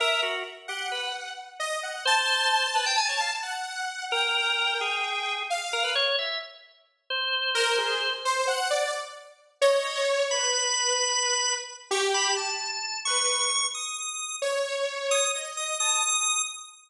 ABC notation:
X:1
M:9/8
L:1/16
Q:3/8=87
K:none
V:1 name="Drawbar Organ"
^A2 ^F2 z2 G2 B2 z8 | c6 B g ^g ^c f z7 | ^A6 ^G6 z2 A B ^c2 | e2 z6 c10 |
z12 ^d4 z2 | b12 z2 ^c' z b2 | a6 ^c'6 ^d'6 | z6 ^d'2 z2 d'2 d'6 |]
V:2 name="Lead 2 (sawtooth)"
e2 z4 ^f6 z2 ^d2 f2 | a12 ^f6 | g12 f4 z2 | z12 ^A2 ^G2 z2 |
c2 ^f2 d2 z6 ^c6 | B12 z2 G4 | z6 B4 z8 | ^c8 ^d4 a2 z4 |]